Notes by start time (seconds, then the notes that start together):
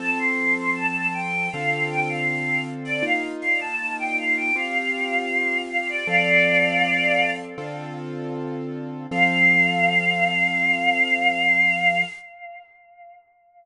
0.00 F3 C4 A4 A5
0.19 C6
0.57 C6
0.76 A5
0.95 A5
1.14 G5
1.52 D3 C4 F4 A4 F5
1.90 G5
2.09 F5
2.28 F5
2.85 D5
3.02 A#3 D#4 F4 F5
3.42 F5
3.61 A5
3.99 G5
4.18 F5
4.37 G5
4.56 C4 F4 G4 F5
5.70 F5
5.89 D5
6.07 F3 C4 A4 D5 F5
7.58 D3 C4 F4 A4
9.11 F3 C4 A4 F5